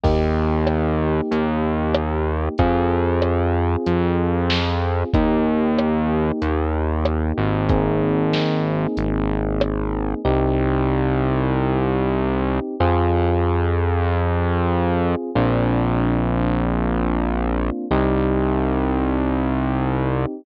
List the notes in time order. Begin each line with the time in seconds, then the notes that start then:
0.03 D#2 A#3 D#4 G4, kick, crash
0.67 cross-stick
1.31 D#2, closed hi-hat
1.95 cross-stick
2.58 F2 C4 F4 G#4, kick, closed hi-hat
3.22 cross-stick
3.86 F2, closed hi-hat
4.50 snare
5.14 D#2 A#3 D#4 G4, kick, closed hi-hat
5.78 cross-stick
6.42 D#2, closed hi-hat
7.05 cross-stick
7.38 G#1
7.69 A#3 C4 D#4 G#4, kick, closed hi-hat
8.33 snare
8.97 G#1, closed hi-hat
9.61 cross-stick
10.25 C2 C4 D#4 G4
12.80 F2 C4 F4 G#4
15.35 A#1 A#3 C4 D4 F4
17.91 C2 C4 D#4 G4